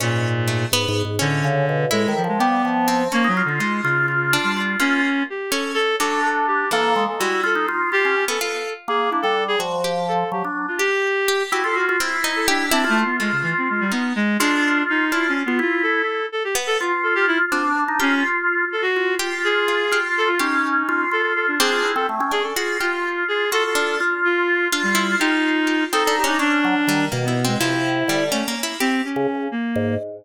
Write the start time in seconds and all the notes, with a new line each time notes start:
0.00 G#2 A#2 C#4
0.48 A3
0.72 G#2 B3
0.88 G#2
1.05 G#2
1.19 A2 D3 C#4
1.44 C#3
1.69 B2
1.91 A2 G#3 E4
2.08 D#3
2.17 F3
2.24 F3
2.28 G#3
2.39 G3 B3 G4
2.65 F3
2.88 C4
3.12 A#3 C#4
3.24 F#3 D#4
3.37 F4
3.45 D3 F4
3.59 G#3 D#4 F4
3.83 C#3 F4
4.08 F4
4.33 D4
4.43 G3
4.57 F4
4.80 A#3 C#4 F4
5.30 G4
5.50 C#4 A4
5.74 A4
6.00 F#3 D4 A4
6.25 A4
6.47 G4
6.71 E3 A#3 A4
6.96 G#3
7.09 A4
7.19 G3 E4 F#4
7.44 F4 A4
7.55 D#4
7.68 F4
7.92 F4 G4
8.05 C#4
8.28 B3 A4
8.41 F4 A4
8.88 A#3 G#4
9.10 D4 E4
9.22 G3 A4
9.48 G#4
9.59 F3 F#4
9.84 G4
10.08 A4
10.32 F#3 G4
10.45 D4
10.68 F4
10.78 G4
11.28 G4
11.52 E4 F#4 G4
11.64 F4 A4
11.75 F#4
11.89 F4
12.00 C4 E4
12.24 D#4
12.36 A4
12.48 D4 G4
12.71 C4 D4 E4
12.84 F4
12.89 A3
13.04 B3
13.20 G#3 A3 F4
13.32 C#3
13.43 E3
13.58 C4
13.70 G#3
13.80 G3
13.92 B3 D#4
14.16 G#3
14.40 G#3 D4 F4
14.90 D#4
15.12 D4 E4 F4
15.29 C#4
15.46 B3 F4
15.59 E4 F4
15.83 A4
16.32 A4
16.44 G4
16.55 B3
16.67 A4
16.80 F4
17.03 A4
17.15 G4
17.27 E4
17.52 C4 D4 F4
17.88 D#4
18.00 C#4 F4 G4
18.72 A4
18.82 F#4
18.96 F4
19.19 F4 G4
19.44 G#4
19.68 F4
19.91 F4 G4
20.18 A4
20.28 F4
20.39 C#4 D#4 G4
20.89 F4
21.11 F4 A4
21.22 A4
21.36 A4
21.48 D4
21.59 C4 D4 G#4
21.72 F4
21.84 E4
21.96 C4 A4
22.09 A3
22.20 C#4
22.31 D4 G#4
22.43 A4
22.56 F4 F#4 G#4
22.80 F4 G4
23.28 G#4
23.52 F4 F#4 A4
23.65 A4
23.75 D4
24.00 F4
24.25 F4
24.72 D4 F4
24.83 G3
24.95 E4
25.20 D#4 F4 G4
25.67 G4
25.93 C4 D#4 A4
26.05 D4 A4
26.17 G4
26.24 C#4 D4 D#4
26.39 C#4 D4
26.64 F#3
26.87 D#3 G3
27.12 B2 A#3
27.24 B3 E4
27.45 G#3 C4
27.59 C3 F3 E4
28.08 D3 G3
28.32 A3 C#4
28.48 A#3
28.63 E4
28.80 C4 G4
29.05 C#4
29.16 C#3
29.52 A#3
29.75 G#2